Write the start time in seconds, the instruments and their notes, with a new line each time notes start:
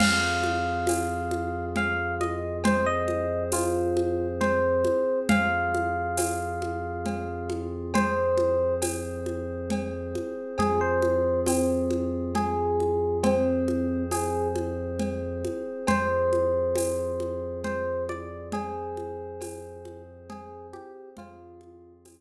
0.00 synth bass 2 F2, pad 5 (bowed) C4 F4 G#4, electric piano 1 F5, crash, cowbell, low conga
0.44 high conga
0.87 tambourine, cowbell, high conga
1.31 high conga
1.76 electric piano 1 F5, cowbell, low conga
2.21 electric piano 1 D#5, high conga
2.64 pad 5 (bowed) C4 G#4 C5, electric piano 1 C5, cowbell, low conga
2.86 electric piano 1 D#5
3.08 high conga
3.52 electric piano 1 F4, tambourine, cowbell, high conga
3.97 high conga
4.41 electric piano 1 C5, cowbell, low conga
4.85 high conga
5.29 synth bass 2 F2, pad 5 (bowed) C4 F4 G#4, electric piano 1 F5, cowbell, low conga
5.74 high conga
6.17 tambourine, cowbell, high conga
6.62 high conga
7.06 cowbell, low conga
7.50 high conga
7.94 pad 5 (bowed) C4 G#4 C5, electric piano 1 C5, cowbell, low conga
8.38 high conga
8.82 tambourine, cowbell, high conga
9.26 high conga
9.70 cowbell, low conga
10.15 high conga
10.58 synth bass 2 F2, pad 5 (bowed) C4 F4 G#4, electric piano 1 G#4, cowbell, low conga
10.81 electric piano 1 C5
11.02 high conga
11.47 electric piano 1 C4, tambourine, cowbell, high conga
11.90 high conga
12.35 electric piano 1 G#4, cowbell, low conga
12.80 high conga
13.23 electric piano 1 C4, pad 5 (bowed) C4 G#4 C5, cowbell, low conga
13.68 high conga
14.11 electric piano 1 G#4, tambourine, cowbell, high conga
14.56 high conga
14.99 cowbell, low conga
15.45 high conga
15.87 synth bass 2 F2, pad 5 (bowed) C4 F4 G#4, electric piano 1 C5, cowbell, low conga
16.33 high conga
16.76 tambourine, cowbell, high conga
17.20 high conga
17.64 electric piano 1 C5, cowbell, low conga
18.09 electric piano 1 D5, high conga
18.52 pad 5 (bowed) C4 G#4 C5, electric piano 1 G#4, cowbell, low conga
18.97 high conga
19.41 tambourine, cowbell, high conga
19.85 high conga
20.30 electric piano 1 G#4, cowbell, low conga
20.73 electric piano 1 G4, high conga
21.17 synth bass 2 F2, pad 5 (bowed) C4 F4 G#4, electric piano 1 F4, cowbell, low conga
21.61 high conga
22.05 tambourine, cowbell, high conga